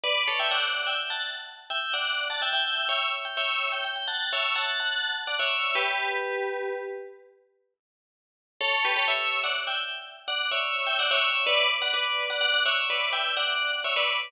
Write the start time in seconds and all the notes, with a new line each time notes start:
0.04 B4 D5
0.28 A4 C#5
0.39 E5 G5
0.51 D5 F#5
0.87 E5 G5
1.10 F#5 A5
1.70 E5 G5
1.94 D5 F#5
2.30 F#5 A5
2.42 E5 G5
2.53 E5 G5
2.89 C#5 E5
3.25 G5
3.37 C#5 E5
3.72 G5
3.84 G5
3.96 G5
4.08 F#5 A5
4.33 C#5 E5
4.56 F#5 A5
4.80 F#5 A5
5.27 D5 F#5
5.39 C#5 E5
5.75 G4 B4
8.61 A4 C#5
8.85 G4 B4
8.96 A4 C#5
9.08 C#5 E5
9.44 D5 F#5
9.67 E5 G5
10.28 D5 F#5
10.51 C#5 E5
10.87 E5 G5
10.99 D5 F#5
11.11 C#5 E5
11.46 B4 D5
11.82 D5 F#5
11.94 B4 D5
12.30 D5 F#5
12.41 D5 F#5
12.54 D5 F#5
12.65 C#5 E5
12.90 B4 D5
13.13 E5 G5
13.37 D5 F#5
13.84 C#5 E5
13.96 B4 D5